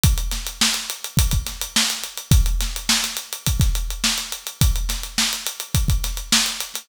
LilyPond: \new DrumStaff \drummode { \time 4/4 \tempo 4 = 105 <hh bd>16 hh16 <hh sn>16 hh16 sn16 hh16 hh16 hh16 <hh bd>16 <hh bd>16 <hh sn>16 hh16 sn16 hh16 hh16 hh16 | <hh bd>16 hh16 <hh sn>16 hh16 sn16 <hh sn>16 hh16 hh16 <hh bd>16 <hh bd sn>16 hh16 hh16 sn16 hh16 hh16 hh16 | <hh bd>16 hh16 <hh sn>16 hh16 sn16 hh16 hh16 hh16 <hh bd>16 <hh bd>16 <hh sn>16 hh16 sn16 hh16 hh16 <hh sn>16 | }